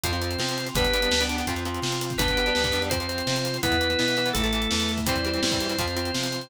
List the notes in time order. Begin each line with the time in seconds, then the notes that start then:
0.04 F2 F3 C4 F4 C5, kick, closed hi-hat
0.13 F3 C4, closed hi-hat
0.22 F3 C4, closed hi-hat
0.31 closed hi-hat
0.38 C3 F3 C4, snare
0.49 closed hi-hat
0.58 closed hi-hat
0.67 closed hi-hat
0.75 G1 G3 B3 D4 G4 B4, kick, closed hi-hat
0.84 kick, closed hi-hat
0.93 G3 B3 D4, closed hi-hat
1.02 G3 B3 D4, closed hi-hat
1.11 D2 G3 B3 D4, snare
1.20 G3 B3 D4, closed hi-hat
1.29 G3 B3 D4, closed hi-hat
1.38 G3 B3 D4, closed hi-hat
1.47 F2 F3 C4 F4, kick, closed hi-hat
1.56 F3 C4, closed hi-hat
1.65 F3 C4, closed hi-hat
1.74 closed hi-hat
1.82 C3 F3 C4, snare
1.92 closed hi-hat
2.01 closed hi-hat
2.10 kick, closed hi-hat
2.18 G1 G3 B3 D4 G4 B4, kick, closed hi-hat
2.28 kick, closed hi-hat
2.37 G3 B3 D4, closed hi-hat
2.46 G3 B3 D4, closed hi-hat
2.55 D2 G3 B3 D4, snare
2.64 G3 B3 D4, kick, closed hi-hat
2.72 F2 G3 B3 D4, closed hi-hat
2.82 G3 B3 D4, closed hi-hat
2.90 F3 C4 F4 C5, kick, closed hi-hat
3.00 F3 C4, closed hi-hat
3.09 F3 C4, closed hi-hat
3.18 closed hi-hat
3.27 C3 F3 C4, snare
3.36 closed hi-hat
3.45 closed hi-hat
3.54 closed hi-hat
3.63 E2 E3 B3 E4 B4, kick, closed hi-hat
3.72 kick, closed hi-hat
3.81 E3 B3, closed hi-hat
3.90 E3 B3, closed hi-hat
3.99 B2 E3 B3, snare
4.08 E3 B3, closed hi-hat
4.17 E3 B3, closed hi-hat
4.26 E3 B3, closed hi-hat
4.33 A1 E3 A3 E4 A4, kick, closed hi-hat
4.44 E3 A3, closed hi-hat
4.53 E3 A3, closed hi-hat
4.62 closed hi-hat
4.71 E2 E3 A3, snare
4.80 closed hi-hat
4.89 closed hi-hat
4.98 kick, closed hi-hat
5.06 E2 E3 G3 C4 E4 C5, kick, closed hi-hat
5.16 kick, closed hi-hat
5.25 E3 G3 C4, closed hi-hat
5.33 E3 G3 C4, closed hi-hat
5.43 G2 E3 G3 C4, snare
5.51 E3 G3 C4, kick, closed hi-hat
5.60 E3 G3 C4, closed hi-hat
5.69 E3 G3 C4, closed hi-hat
5.78 F2 F3 C4 F4 C5, kick, closed hi-hat
5.87 F3 C4, closed hi-hat
5.96 F3 C4, closed hi-hat
6.05 closed hi-hat
6.14 C3 F3 C4, snare
6.24 closed hi-hat
6.32 closed hi-hat
6.41 closed hi-hat